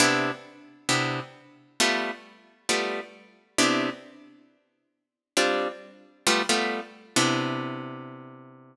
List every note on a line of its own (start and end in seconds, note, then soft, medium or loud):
0.00 0.31 C3 loud
0.00 0.31 B3 loud
0.00 0.31 D4 loud
0.00 0.31 E4 loud
0.89 1.20 C3 medium
0.89 1.20 B3 medium
0.89 1.20 D4 medium
0.89 1.20 E4 medium
1.80 2.11 G3 loud
1.80 2.11 A3 loud
1.80 2.11 B3 loud
1.80 2.11 F4 medium
2.69 3.00 G3 medium
2.69 3.00 A3 medium
2.69 3.00 B3 medium
2.69 3.00 F4 medium
3.58 3.90 C3 loud
3.58 3.90 B3 loud
3.58 3.90 D4 loud
3.58 3.90 E4 loud
5.37 5.68 G3 medium
5.37 5.68 C4 loud
5.37 5.68 D4 medium
5.37 5.68 F4 loud
6.27 6.42 G3 loud
6.27 6.42 A3 loud
6.27 6.42 B3 loud
6.27 6.42 F4 loud
6.49 6.81 G3 medium
6.49 6.81 A3 loud
6.49 6.81 B3 medium
6.49 6.81 F4 loud
7.16 8.76 C3 loud
7.16 8.76 B3 medium
7.16 8.76 D4 loud
7.16 8.76 E4 medium